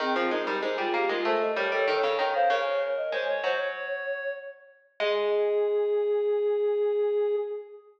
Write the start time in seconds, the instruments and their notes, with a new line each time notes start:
0.00 pizzicato strings D#3, clarinet C4, ocarina G#4
0.16 pizzicato strings F3, clarinet C4
0.31 pizzicato strings G#3, clarinet D#4, ocarina A#4
0.47 pizzicato strings G3, ocarina A#4
0.62 pizzicato strings G#3, clarinet D#4, ocarina C5
0.78 pizzicato strings G3, clarinet F4, ocarina G#4
0.94 pizzicato strings A#3, clarinet G4
1.09 pizzicato strings G#3, clarinet F4, ocarina A#4
1.25 pizzicato strings A3, clarinet A4, ocarina C5
1.41 ocarina D#5
1.56 pizzicato strings G3, clarinet A#4, ocarina C#5
1.72 pizzicato strings G3, clarinet A4, ocarina C#5
1.88 pizzicato strings D#3, clarinet A4, ocarina C#5
2.03 pizzicato strings C#3
2.18 pizzicato strings D#3, clarinet A#4, ocarina C#5
2.34 clarinet C5, ocarina F5
2.50 pizzicato strings C#3, clarinet A#4, ocarina C#5
2.97 ocarina D#5
3.12 pizzicato strings G#3, clarinet C5, ocarina C#5
3.28 clarinet C#5, ocarina C#5
3.44 pizzicato strings F#3, clarinet C5, ocarina C#5
3.59 clarinet C#5
5.00 pizzicato strings G#3, clarinet G#4, ocarina G#4